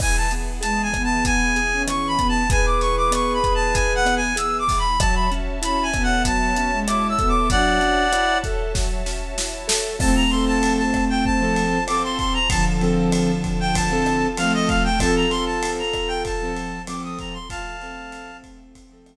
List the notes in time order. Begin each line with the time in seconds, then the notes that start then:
0.00 E3 B3 G#4 G#5, kick, cross-stick, crash
0.17 A5
0.31 B3, closed hi-hat
0.61 G#3 G#4 A5, closed hi-hat
0.83 G#5
0.92 E3 B3, kick, cross-stick, closed hi-hat
1.04 A5
1.25 B3 G#5, kick, closed hi-hat
1.56 G#4, closed hi-hat
1.72 C#4
1.87 E3 C#6, cross-stick, closed hi-hat
2.08 B5
2.18 B3, kick, closed hi-hat
2.29 A5
2.49 G#4 B4 G#5, kick, closed hi-hat
2.66 D6
2.81 E3 C#6, snare, closed hi-hat
2.97 D6
3.11 B3 C#6, cross-stick, closed hi-hat
3.34 B5
3.43 G#4, kick, closed hi-hat
3.55 A5
3.74 E3 G#5, kick, closed hi-hat
3.95 F#5
4.05 B3, cross-stick, closed hi-hat
4.16 G#5
4.36 G#4 E6, closed hi-hat
4.59 D6
4.67 E3, kick, open hi-hat
4.79 B5
5.00 F#3 F#4 C#5 E5 A5, kick, cross-stick, closed hi-hat
5.15 B5
5.32 C#4, closed hi-hat
5.62 C#4 E4 B5, closed hi-hat
5.83 G#5
5.93 B3 A4, kick, cross-stick, closed hi-hat
6.03 F#5
6.25 F#3 A5, kick, closed hi-hat
6.56 C#4, closed hi-hat
6.72 G#3
6.87 E4 D6, cross-stick, closed hi-hat
7.09 E6
7.19 B3 A4, kick, closed hi-hat
7.29 D6
7.50 F#3 D4 F#4 D5 F#5, kick, closed hi-hat
7.80 C#4, closed hi-hat
8.12 E4, cross-stick, closed hi-hat
8.44 A4, kick, snare, closed hi-hat
8.74 F#3, kick, snare
9.06 C#4, snare
9.38 E4, snare
9.68 A4, snare
9.99 F3 A3 C4 F4 A4 C5 A5, kick, cross-stick, crash
10.16 A#5
10.30 F3 C4 C6, ride
10.34 A4
10.47 A5
10.63 ride
10.78 A5
10.94 kick, cross-stick, ride
11.10 G5
11.25 A5, kick
11.41 F3 C4 A4
11.56 ride
11.87 F3 C4 A4 D6, cross-stick, ride
12.04 C6
12.19 C6, kick, ride
12.34 A#5
12.49 D3 F3 F4 A4 A5, kick, ride
12.81 F3 C4 A4, ride
13.12 cross-stick, ride
13.44 kick, ride
13.60 G5
13.75 A5, kick, ride
13.90 F3 C4 A4
14.06 cross-stick, ride
14.37 F3 A3 C4 A4 F5, ride
14.54 D#5
14.68 F5, kick, ride
14.84 G5
14.99 F3 C4 F4 A4 A5, kick, cross-stick, ride
15.16 A#5
15.30 F3 C4 A4 C6, ride
15.46 A5
15.63 ride
15.79 A#5
15.93 kick, cross-stick, ride
16.08 G5
16.25 A5, kick, ride
16.42 F3 C4 A4
16.57 ride
16.87 F3 C4 A4 D6, cross-stick, ride
17.04 D#6
17.19 A#5, kick, ride
17.33 C6
17.48 F3 A3 F4 A4 F5 A5, kick, ride
17.80 F3 C4 A4, ride
18.12 cross-stick, ride
18.44 kick, ride
18.75 kick, ride
18.91 F3 C4 A4
19.06 cross-stick, ride